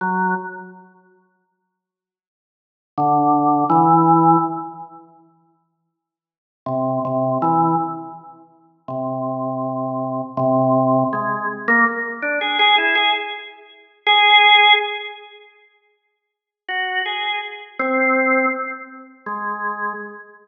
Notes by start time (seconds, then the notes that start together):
0.01 F#3
2.98 D3
3.70 E3
6.66 C3
7.05 C3
7.42 E3
8.88 C3
10.37 C3
11.13 G#3
11.68 A#3
12.22 D4
12.41 G#4
12.59 G#4
12.78 E4
12.95 G#4
14.06 G#4
16.69 F#4
17.06 G#4
17.79 C4
19.26 G#3